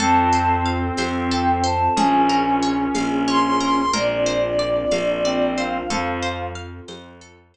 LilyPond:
<<
  \new Staff \with { instrumentName = "Choir Aahs" } { \time 6/8 \key f \mixolydian \tempo 4. = 61 a''4 r4 g''8 a''8 | aes''4 r4 c'''8 c'''8 | d''2~ d''8 f''8 | f''4 r2 | }
  \new Staff \with { instrumentName = "Lead 1 (square)" } { \time 6/8 \key f \mixolydian c'2. | des'2. | r2 c'4 | f4 r2 | }
  \new Staff \with { instrumentName = "Orchestral Harp" } { \time 6/8 \key f \mixolydian a'8 c''8 f''8 c''8 a'8 c''8 | aes'8 bes'8 des''8 f''8 des''8 bes'8 | bes'8 c''8 d''8 f''8 d''8 c''8 | a'8 c''8 f''8 c''8 a'8 c''8 | }
  \new Staff \with { instrumentName = "Electric Bass (finger)" } { \clef bass \time 6/8 \key f \mixolydian f,4. f,4. | bes,,4. bes,,4. | bes,,4. bes,,4. | f,4. f,4. | }
  \new Staff \with { instrumentName = "Pad 2 (warm)" } { \time 6/8 \key f \mixolydian <c' f' a'>2. | <des' f' aes' bes'>2. | <c' d' f' bes'>2. | <c' f' a'>2. | }
  \new DrumStaff \with { instrumentName = "Drums" } \drummode { \time 6/8 cgl4. <cgho tamb>4. | cgl4. <cgho tamb>4. | cgl4. <cgho tamb>4. | cgl4. <cgho tamb>4. | }
>>